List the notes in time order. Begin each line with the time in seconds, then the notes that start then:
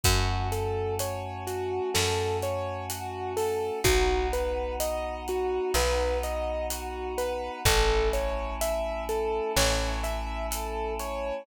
0.04 F#2 A3 C#4 F#4, kick, closed hi-hat
0.52 A4, closed hi-hat
0.99 C#5, closed hi-hat
1.47 F#4, closed hi-hat
1.94 F#2 A4, snare
2.42 C#5, closed hi-hat
2.90 F#4, closed hi-hat
3.37 A4, open hi-hat
3.84 B1 B3 D#4 F#4, kick, closed hi-hat
4.33 B4, closed hi-hat
4.80 D#5, closed hi-hat
5.28 F#4, closed hi-hat
5.74 B1 B4, snare
6.23 D#5, closed hi-hat
6.70 F#4, closed hi-hat
7.18 B4, closed hi-hat
7.65 A1 A3 C#4 E4 A4, kick, closed hi-hat
8.13 C#5, closed hi-hat
8.61 E5, closed hi-hat
9.09 A4, closed hi-hat
9.57 A1 C#5, snare
10.04 E5, closed hi-hat
10.51 A4, closed hi-hat
10.99 C#5, closed hi-hat